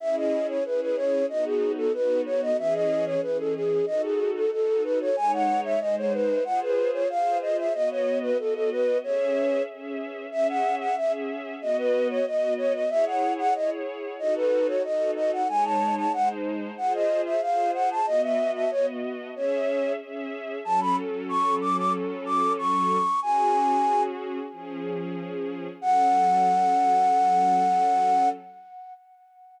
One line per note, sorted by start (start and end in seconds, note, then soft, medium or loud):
0.00 0.58 C#4 loud
0.00 0.58 E4 loud
0.00 0.58 G#4 loud
0.00 0.16 E5 medium
0.16 0.47 D#5 medium
0.49 0.64 C#5 medium
0.65 1.23 C#4 loud
0.65 1.23 E4 medium
0.65 1.23 G#4 loud
0.65 0.81 B4 medium
0.81 0.96 B4 medium
0.96 1.26 C#5 medium
1.29 1.87 B3 loud
1.29 1.87 D#4 loud
1.29 1.87 F#4 loud
1.29 1.45 D#5 medium
1.45 1.72 G#4 medium
1.77 1.92 A4 medium
1.94 2.52 B3 loud
1.94 2.52 D#4 medium
1.94 2.52 F#4 loud
1.94 2.21 B4 medium
2.26 2.41 C#5 medium
2.42 2.57 D#5 medium
2.58 3.16 E3 loud
2.58 3.16 C#4 loud
2.58 3.16 G#4 loud
2.58 2.74 E5 medium
2.74 3.05 D#5 medium
3.06 3.21 C#5 medium
3.22 3.81 E3 medium
3.22 3.81 C#4 medium
3.22 3.81 G#4 medium
3.22 3.38 B4 medium
3.39 3.54 A4 medium
3.55 3.85 G#4 medium
3.86 4.45 D#4 loud
3.86 4.45 F#4 loud
3.86 4.45 A4 loud
3.86 4.02 D#5 medium
4.02 4.31 G#4 medium
4.35 4.51 A4 medium
4.52 5.10 D#4 medium
4.52 5.10 F#4 medium
4.52 5.10 A4 medium
4.52 4.83 A4 medium
4.84 4.99 B4 medium
5.01 5.16 C#5 medium
5.16 5.74 G#3 loud
5.16 5.74 D#4 loud
5.16 5.74 C#5 loud
5.16 5.32 G#5 medium
5.33 5.60 F#5 medium
5.64 5.80 E5 medium
5.80 6.39 G#3 loud
5.80 6.39 D#4 medium
5.80 6.39 C5 loud
5.80 5.95 D#5 medium
5.98 6.13 C#5 medium
6.13 6.44 B4 medium
6.45 7.03 F4 loud
6.45 7.03 G#4 loud
6.45 7.03 C5 loud
6.45 6.60 F#5 medium
6.62 6.91 B4 medium
6.93 7.08 C#5 medium
7.10 7.68 F4 loud
7.10 7.68 G#4 medium
7.10 7.68 C5 loud
7.10 7.38 F5 medium
7.42 7.57 D#5 medium
7.58 7.73 E5 medium
7.74 8.32 B3 loud
7.74 8.32 F#4 loud
7.74 7.89 D#5 medium
7.74 8.32 D#5 loud
7.91 8.18 C#5 medium
8.22 8.37 B4 medium
8.39 8.97 B3 medium
8.39 8.97 F#4 medium
8.39 8.54 A4 medium
8.39 8.97 D#5 medium
8.54 8.70 A4 medium
8.72 8.98 B4 medium
9.03 9.61 C#4 loud
9.03 9.61 G#4 loud
9.03 9.63 C#5 medium
9.03 9.61 E5 loud
9.68 10.26 C#4 medium
9.68 10.26 G#4 medium
9.68 10.26 E5 medium
10.32 10.90 C#4 loud
10.32 10.90 G#4 loud
10.32 10.47 E5 medium
10.32 10.90 E5 loud
10.49 10.75 F#5 medium
10.80 10.96 F#5 medium
10.97 11.55 C#4 loud
10.97 11.55 G#4 loud
10.97 11.55 E5 loud
10.97 11.12 E5 medium
11.61 12.19 B3 loud
11.61 12.19 F#4 loud
11.61 12.19 D#5 loud
11.61 11.77 D#5 medium
11.78 12.08 B4 medium
12.10 12.25 C#5 medium
12.26 12.84 B3 loud
12.26 12.84 F#4 loud
12.26 12.84 D#5 loud
12.26 12.54 D#5 medium
12.58 12.73 C#5 medium
12.74 12.90 D#5 medium
12.89 13.48 E4 loud
12.89 13.48 G#4 loud
12.89 13.48 C#5 loud
12.89 13.05 E5 medium
13.06 13.33 F#5 medium
13.38 13.54 F#5 medium
13.55 14.13 E4 medium
13.55 14.13 G#4 loud
13.55 14.13 C#5 loud
13.55 13.70 D#5 medium
14.19 14.77 D#4 loud
14.19 14.77 F#4 loud
14.19 14.77 A4 loud
14.19 14.34 D#5 medium
14.36 14.67 B4 medium
14.67 14.83 C#5 medium
14.84 15.42 D#4 loud
14.84 15.42 F#4 loud
14.84 15.42 A4 loud
14.84 15.11 D#5 medium
15.16 15.31 D#5 medium
15.33 15.48 F#5 medium
15.48 16.06 G#3 loud
15.48 16.06 D#4 loud
15.48 16.06 C#5 loud
15.48 15.64 G#5 medium
15.64 15.95 A5 medium
15.97 16.12 A5 medium
16.13 16.71 G#3 loud
16.13 16.71 D#4 loud
16.13 16.71 C5 loud
16.13 16.29 F#5 medium
16.77 17.35 F4 loud
16.77 17.35 G#4 loud
16.77 17.35 C5 loud
16.77 16.93 F#5 medium
16.94 17.21 D#5 medium
17.26 17.41 E5 medium
17.41 18.00 F4 medium
17.41 18.00 G#4 loud
17.41 18.00 C5 loud
17.41 17.71 F5 medium
17.74 17.89 F#5 medium
17.91 18.06 A5 medium
18.06 18.65 B3 loud
18.06 18.65 F#4 loud
18.06 18.22 D#5 medium
18.06 18.65 D#5 loud
18.23 18.51 E5 medium
18.55 18.70 E5 medium
18.71 19.29 B3 loud
18.71 19.29 F#4 loud
18.71 18.86 C#5 medium
18.71 19.29 D#5 medium
19.35 19.94 C#4 loud
19.35 19.94 G#4 loud
19.35 19.93 C#5 medium
19.35 19.94 E5 loud
20.00 20.58 C#4 loud
20.00 20.58 G#4 loud
20.00 20.58 E5 loud
20.65 22.97 F#3 loud
20.65 22.97 C#4 loud
20.65 22.97 A4 loud
20.65 20.80 A5 medium
20.81 20.96 B5 medium
21.29 21.55 C#6 medium
21.61 21.76 D6 medium
21.77 21.93 D6 medium
22.26 22.53 D6 medium
22.58 23.20 C#6 medium
23.22 24.39 C#4 loud
23.22 24.39 F#4 loud
23.22 24.39 G#4 loud
23.22 24.03 G#5 medium
24.52 25.68 F3 loud
24.52 25.68 C#4 loud
24.52 25.68 G#4 loud
25.81 28.28 F#3 medium
25.81 28.28 C#4 medium
25.81 28.28 A4 loud
25.81 28.29 F#5 loud